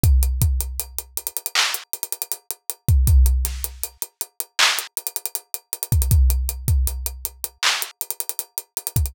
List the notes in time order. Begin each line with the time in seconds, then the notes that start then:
0.03 kick, closed hi-hat
0.23 closed hi-hat
0.42 kick, closed hi-hat
0.61 closed hi-hat
0.80 closed hi-hat
0.99 closed hi-hat
1.17 closed hi-hat
1.27 closed hi-hat
1.37 closed hi-hat
1.46 closed hi-hat
1.55 clap
1.74 closed hi-hat
1.93 closed hi-hat
2.03 closed hi-hat
2.13 closed hi-hat
2.22 closed hi-hat
2.32 closed hi-hat
2.51 closed hi-hat
2.70 closed hi-hat
2.88 kick, closed hi-hat
3.07 kick, closed hi-hat
3.26 closed hi-hat
3.45 snare, closed hi-hat
3.64 closed hi-hat
3.84 closed hi-hat
4.02 closed hi-hat
4.21 closed hi-hat
4.40 closed hi-hat
4.59 clap
4.79 closed hi-hat
4.97 closed hi-hat
5.07 closed hi-hat
5.16 closed hi-hat
5.26 closed hi-hat
5.35 closed hi-hat
5.54 closed hi-hat
5.73 closed hi-hat
5.83 closed hi-hat
5.92 kick, closed hi-hat
6.02 closed hi-hat
6.11 kick, closed hi-hat
6.30 closed hi-hat
6.49 closed hi-hat
6.68 kick, closed hi-hat
6.87 closed hi-hat
7.06 closed hi-hat
7.25 closed hi-hat
7.44 closed hi-hat
7.63 clap
7.82 closed hi-hat
8.01 closed hi-hat
8.10 closed hi-hat
8.20 closed hi-hat
8.29 closed hi-hat
8.39 closed hi-hat
8.58 closed hi-hat
8.77 closed hi-hat
8.87 closed hi-hat
8.96 kick, closed hi-hat
9.06 closed hi-hat